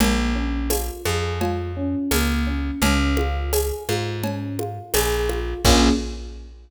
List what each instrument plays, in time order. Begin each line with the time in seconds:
0.00 electric bass (finger) A#1, electric piano 1 A#3, cowbell, low conga
0.36 electric piano 1 C#4
0.70 electric piano 1 F4, tambourine, cowbell, high conga
1.05 electric bass (finger) F2, electric piano 1 G#4, high conga
1.41 electric piano 1 F4, cowbell, low conga
1.77 electric piano 1 C#4
2.11 electric bass (finger) C#2, electric piano 1 A#3, tambourine, cowbell, high conga
2.47 electric piano 1 C#4
2.82 electric bass (finger) C#2, electric piano 1 C#4, cowbell, low conga
3.17 electric piano 1 F4, high conga
3.53 electric piano 1 G#4, tambourine, cowbell, high conga
3.89 electric bass (finger) G#2, electric piano 1 F4, high conga
4.24 electric piano 1 C#4, cowbell, low conga
4.59 electric piano 1 F4, high conga
4.94 electric bass (finger) A#1, electric piano 1 G#4, tambourine, cowbell, high conga
5.29 electric piano 1 F4, high conga
5.65 electric bass (finger) A#1, electric piano 1 A#3 C#4 F4 G#4, kick, crash